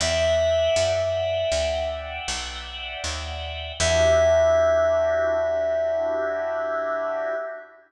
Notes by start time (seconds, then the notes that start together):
0.00 E2 D5 E5 F#5 G5
0.76 F#2
1.52 D2
2.28 B1
3.04 D#2
3.80 E2 D4 E4 F#4 G4 E5